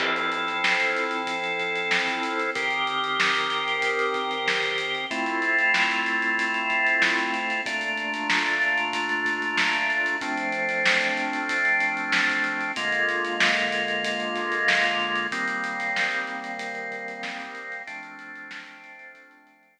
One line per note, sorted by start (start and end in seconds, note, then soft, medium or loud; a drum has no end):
0.00 2.50 F3 medium
0.00 2.50 C4 medium
0.00 2.50 E4 medium
0.00 2.50 A4 medium
0.00 kick loud
0.00 crash loud
0.16 closed hi-hat medium
0.32 closed hi-hat medium
0.47 snare soft
0.47 closed hi-hat medium
0.64 snare loud
0.80 closed hi-hat medium
0.97 closed hi-hat medium
1.11 closed hi-hat medium
1.27 kick medium
1.27 closed hi-hat medium
1.44 closed hi-hat medium
1.59 kick medium
1.59 closed hi-hat medium
1.76 closed hi-hat medium
1.91 snare loud
2.07 kick medium
2.07 snare soft
2.07 closed hi-hat medium
2.23 closed hi-hat medium
2.39 closed hi-hat medium
2.55 5.06 D#3 medium
2.55 5.06 C4 medium
2.55 5.06 G4 medium
2.55 5.06 A#4 medium
2.55 kick loud
2.55 closed hi-hat medium
2.71 closed hi-hat medium
2.87 closed hi-hat medium
3.04 closed hi-hat medium
3.20 snare loud
3.35 closed hi-hat medium
3.50 snare soft
3.50 closed hi-hat medium
3.68 closed hi-hat medium
3.82 kick medium
3.82 closed hi-hat loud
3.99 closed hi-hat medium
4.14 kick medium
4.14 closed hi-hat medium
4.31 closed hi-hat medium
4.48 snare medium
4.63 kick medium
4.63 closed hi-hat medium
4.78 closed hi-hat medium
4.95 closed hi-hat medium
5.11 7.61 A3 medium
5.11 7.61 C4 medium
5.11 7.61 E4 medium
5.11 7.61 F4 medium
5.11 kick medium
5.11 closed hi-hat medium
5.26 snare soft
5.26 closed hi-hat medium
5.42 closed hi-hat medium
5.59 closed hi-hat medium
5.74 snare loud
5.91 closed hi-hat medium
6.06 snare soft
6.06 closed hi-hat medium
6.22 closed hi-hat medium
6.38 kick medium
6.38 closed hi-hat medium
6.54 closed hi-hat medium
6.70 kick medium
6.70 closed hi-hat medium
6.87 closed hi-hat medium
7.02 snare loud
7.18 kick medium
7.18 closed hi-hat medium
7.34 closed hi-hat medium
7.50 closed hi-hat medium
7.66 10.16 A#2 medium
7.66 10.16 A3 medium
7.66 10.16 D4 medium
7.66 10.16 F4 medium
7.66 kick loud
7.66 closed hi-hat loud
7.81 closed hi-hat medium
7.97 closed hi-hat medium
8.14 closed hi-hat medium
8.30 snare loud
8.46 closed hi-hat medium
8.62 closed hi-hat medium
8.78 closed hi-hat medium
8.93 kick medium
8.93 closed hi-hat loud
9.09 closed hi-hat medium
9.26 kick medium
9.26 closed hi-hat medium
9.42 closed hi-hat medium
9.57 snare loud
9.73 kick medium
9.73 closed hi-hat medium
9.90 closed hi-hat medium
10.06 closed hi-hat medium
10.21 12.72 F3 medium
10.21 12.72 A3 medium
10.21 12.72 C4 medium
10.21 12.72 D4 medium
10.21 kick loud
10.21 closed hi-hat medium
10.38 closed hi-hat medium
10.52 closed hi-hat medium
10.69 snare soft
10.69 closed hi-hat medium
10.86 snare loud
11.01 closed hi-hat medium
11.17 closed hi-hat medium
11.33 closed hi-hat medium
11.49 kick medium
11.49 closed hi-hat loud
11.65 closed hi-hat medium
11.80 kick medium
11.80 closed hi-hat medium
11.97 closed hi-hat medium
12.12 snare loud
12.30 kick medium
12.30 closed hi-hat medium
12.44 closed hi-hat medium
12.61 closed hi-hat medium
12.76 15.27 D3 medium
12.76 15.27 G#3 medium
12.76 15.27 A#3 medium
12.76 15.27 F4 medium
12.76 kick medium
12.76 closed hi-hat loud
12.92 closed hi-hat medium
13.09 closed hi-hat medium
13.25 closed hi-hat medium
13.40 snare loud
13.57 closed hi-hat medium
13.72 closed hi-hat medium
13.88 closed hi-hat medium
14.04 kick medium
14.04 closed hi-hat loud
14.20 closed hi-hat medium
14.36 kick medium
14.36 snare soft
14.36 closed hi-hat medium
14.52 closed hi-hat medium
14.68 snare loud
14.84 kick medium
14.84 snare soft
14.84 closed hi-hat medium
15.00 closed hi-hat soft
15.16 closed hi-hat medium
15.32 17.82 D#3 medium
15.32 17.82 G3 medium
15.32 17.82 A#3 medium
15.32 17.82 C4 medium
15.32 kick loud
15.32 closed hi-hat medium
15.48 closed hi-hat medium
15.64 closed hi-hat medium
15.80 snare soft
15.80 closed hi-hat medium
15.96 snare medium
16.12 closed hi-hat medium
16.27 closed hi-hat medium
16.44 closed hi-hat medium
16.59 kick medium
16.59 closed hi-hat loud
16.75 closed hi-hat medium
16.92 kick medium
16.92 closed hi-hat medium
17.08 closed hi-hat medium
17.23 snare medium
17.39 kick medium
17.39 closed hi-hat medium
17.55 closed hi-hat medium
17.72 snare soft
17.72 closed hi-hat medium
17.87 19.79 F3 medium
17.87 19.79 A3 medium
17.87 19.79 C4 medium
17.87 19.79 D4 medium
17.87 kick loud
17.87 closed hi-hat medium
18.03 closed hi-hat medium
18.19 closed hi-hat medium
18.36 snare soft
18.36 closed hi-hat medium
18.51 snare loud
18.66 snare soft
18.66 closed hi-hat medium
18.83 snare soft
18.83 closed hi-hat medium
18.99 closed hi-hat medium
19.14 kick medium
19.14 closed hi-hat medium
19.31 closed hi-hat medium
19.47 kick medium
19.47 closed hi-hat medium
19.63 closed hi-hat medium
19.79 snare medium